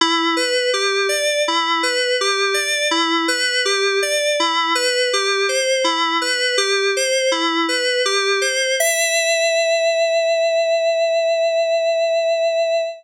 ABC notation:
X:1
M:6/4
L:1/8
Q:1/4=82
K:Em
V:1 name="Electric Piano 2"
E B G d E B G d E B G d | E B G c E B G c E B G c | e12 |]